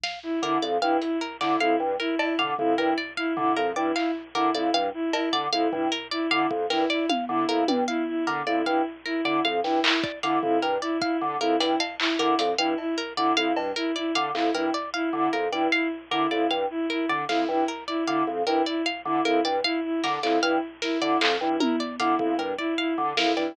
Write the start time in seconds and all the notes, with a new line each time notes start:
0.04 F5, snare
0.23 E4
0.42 D3 E4 A#4
0.62 F2 D5
0.82 G2 E4 F5
1.02 E4, closed hi-hat
1.21 A#4
1.41 D3 E4 D5, clap
1.60 F2 E4 F5
1.80 G2
2.00 E4 A#4
2.19 E4 D5, cowbell
2.39 D3 F5, floor tom
2.58 F2 E4, floor tom
2.78 G2 E4 A#4
2.98 D5
3.17 E4 F5
3.37 D3 E4, floor tom
3.57 F2 A#4, cowbell
3.76 G2 E4 D5
3.96 E4 F5, clap
4.35 D3 E4 A#4
4.55 F2 E4 D5
4.74 G2 F5
4.94 E4
5.13 E4 A#4, cowbell
5.33 D3 D5
5.52 F2 E4 F5
5.72 G2 E4, floor tom
5.92 A#4
6.11 E4 D5
6.31 D3 E4 F5
6.51 F2, kick
6.70 G2 E4 A#4, snare
6.90 E4 D5
7.09 F5, high tom
7.29 D3 E4
7.49 F2 E4 A#4
7.68 G2 D5, high tom
7.88 E4 F5
8.08 E4
8.27 D3 A#4
8.47 F2 E4 D5
8.66 G2 E4 F5
9.06 E4 A#4
9.25 D3 E4 D5
9.45 F2 F5
9.64 G2 E4, snare
9.84 E4 A#4, clap
10.04 D5, kick
10.23 D3 E4 F5, closed hi-hat
10.43 F2 E4, floor tom
10.62 G2 A#4
10.82 E4 D5
11.02 E4 F5, kick
11.21 D3
11.41 F2 E4 A#4
11.60 G2 E4 D5, closed hi-hat
11.80 F5, cowbell
12.00 E4, clap
12.19 D3 E4 A#4
12.39 F2 D5, closed hi-hat
12.58 G2 E4 F5
12.78 E4, cowbell
12.98 A#4
13.17 D3 E4 D5
13.37 F2 E4 F5
13.57 G2, cowbell
13.76 E4 A#4
13.96 E4 D5
14.15 D3 F5, closed hi-hat
14.35 F2 E4, clap
14.54 G2 E4 A#4
14.74 D5
14.94 E4 F5
15.13 D3 E4
15.33 F2 A#4
15.52 G2 E4 D5
15.72 E4 F5, closed hi-hat
16.11 D3 E4 A#4
16.31 F2 E4 D5
16.50 G2 F5
16.70 E4
16.90 E4 A#4
17.09 D3 D5
17.29 F2 E4 F5, snare
17.49 G2 E4
17.68 A#4
17.88 E4 D5
18.08 D3 E4 F5
18.27 F2
18.47 G2 E4 A#4, cowbell
18.66 E4 D5
18.86 F5
19.05 D3 E4
19.25 F2 E4 A#4
19.45 G2 D5
19.64 E4 F5
19.84 E4
20.04 D3 A#4, snare
20.23 F2 E4 D5, clap
20.43 G2 E4 F5
20.82 E4 A#4, snare
21.01 D3 E4 D5
21.21 F2 F5, clap
21.41 G2 E4
21.60 E4 A#4, high tom
21.80 D5
22.00 D3 E4 F5, closed hi-hat
22.19 F2 E4, kick
22.39 G2 A#4
22.58 E4 D5
22.78 E4 F5
22.98 D3
23.17 F2 E4 A#4, snare
23.37 G2 E4 D5